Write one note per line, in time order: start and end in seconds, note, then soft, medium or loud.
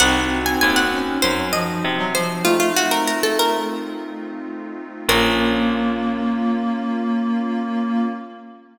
0.00 0.56 C2 loud
0.00 0.85 C4 loud
0.00 2.20 C4 medium
0.00 2.43 C4 medium
0.00 2.20 D#4 medium
0.00 2.43 D#4 medium
0.00 2.20 F#4 medium
0.00 2.43 F#4 medium
0.00 0.45 F#5 loud
0.46 0.60 G#5 medium
0.61 1.18 D#2 loud
0.61 0.76 G#5 loud
0.76 0.91 F#5 medium
0.92 1.20 C#4 medium
1.22 1.79 F#2 medium
1.22 1.48 F#3 medium
1.22 1.50 C5 loud
1.53 1.79 F3 medium
1.53 2.08 D#5 medium
1.84 2.40 C3 medium
1.99 2.14 F#3 medium
2.14 2.39 F3 loud
2.14 2.43 C5 medium
2.45 3.58 A3 loud
2.45 5.06 A3 medium
2.45 4.81 A3 medium
2.45 5.06 C4 medium
2.45 4.81 C4 medium
2.45 5.06 D#4 medium
2.45 4.81 D#4 medium
2.45 2.59 F4 medium
2.45 5.06 F4 loud
2.45 4.81 F4 medium
2.60 2.74 F4 medium
2.76 2.91 F#4 medium
2.91 3.06 A#4 medium
3.07 3.23 A#4 medium
3.23 3.38 A4 medium
3.39 4.33 A#4 loud
5.09 8.07 A#1 loud
5.09 8.07 A#3 loud
5.09 8.08 A#3 loud
5.09 8.07 C#4 medium
5.09 8.08 C#4 loud
5.09 8.07 F4 loud
5.09 8.08 F4 loud
5.09 8.07 A#4 loud